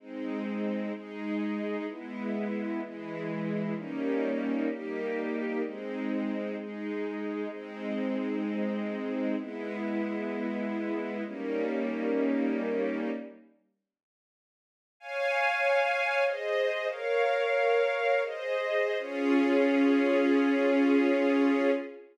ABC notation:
X:1
M:3/4
L:1/8
Q:1/4=96
K:Ab
V:1 name="String Ensemble 1"
[A,CE]3 [A,EA]3 | [A,_C_F]3 [_F,A,F]3 | [G,B,DE]3 [G,B,EG]3 | [A,CE]3 [A,EA]3 |
[A,CE]6 | [A,_C_F]6 | [G,B,DE]6 | z6 |
[K:Db] [dfa]4 [Ace]2 | "^rit." [Bdf]4 [Ace]2 | [DFA]6 |]